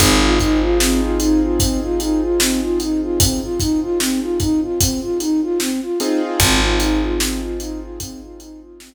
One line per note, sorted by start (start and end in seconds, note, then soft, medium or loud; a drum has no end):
0.00 5.90 G#1 medium
0.00 0.20 C4 loud
0.00 5.71 C4 medium
0.00 5.71 D#4 medium
0.00 5.71 F4 medium
0.00 5.71 G#4 medium
0.00 kick medium
0.00 closed hi-hat medium
0.22 0.39 F4 medium
0.40 0.61 D#4 medium
0.40 kick medium
0.40 closed hi-hat medium
0.62 0.78 F4 medium
0.80 1.01 C4 medium
0.80 snare loud
1.02 1.19 F4 medium
1.20 1.40 D#4 medium
1.20 closed hi-hat medium
1.42 1.59 F4 medium
1.60 1.81 C4 medium
1.60 kick medium
1.60 closed hi-hat medium
1.83 1.99 F4 medium
2.00 2.21 D#4 medium
2.00 closed hi-hat medium
2.22 2.39 F4 medium
2.40 2.60 C4 medium
2.40 snare loud
2.62 2.78 F4 medium
2.80 3.01 D#4 medium
2.80 closed hi-hat medium
3.02 3.19 F4 medium
3.20 3.40 C4 medium
3.20 kick medium
3.20 closed hi-hat loud
3.42 3.59 F4 medium
3.60 3.80 D#4 medium
3.60 kick medium
3.60 closed hi-hat medium
3.82 3.99 F4 medium
4.00 4.20 C4 medium
4.00 snare medium
4.22 4.38 F4 medium
4.40 4.60 D#4 medium
4.40 kick medium
4.40 closed hi-hat medium
4.62 4.79 F4 medium
4.80 5.00 C4 medium
4.80 kick medium
4.80 closed hi-hat loud
5.02 5.19 F4 medium
5.20 5.41 D#4 medium
5.20 closed hi-hat medium
5.43 5.59 F4 medium
5.60 5.80 C4 medium
5.60 snare medium
5.82 5.99 F4 medium
6.00 8.94 C4 loud
6.00 6.20 D#4 medium
6.00 8.94 D#4 medium
6.00 8.94 F4 medium
6.00 8.94 G#4 medium
6.00 closed hi-hat medium
6.22 6.39 F4 medium
6.40 8.94 G#1 medium
6.40 6.60 C4 medium
6.40 kick medium
6.40 closed hi-hat loud
6.62 6.79 F4 medium
6.80 7.01 D#4 medium
6.80 closed hi-hat medium
7.02 7.19 F4 medium
7.20 7.40 C4 medium
7.20 snare loud
7.42 7.58 F4 medium
7.60 7.80 D#4 medium
7.60 closed hi-hat medium
7.82 7.99 F4 medium
8.00 8.21 C4 medium
8.00 kick medium
8.00 closed hi-hat loud
8.22 8.38 F4 medium
8.40 8.60 D#4 medium
8.40 closed hi-hat medium
8.62 8.79 F4 medium
8.80 8.94 C4 medium
8.80 snare loud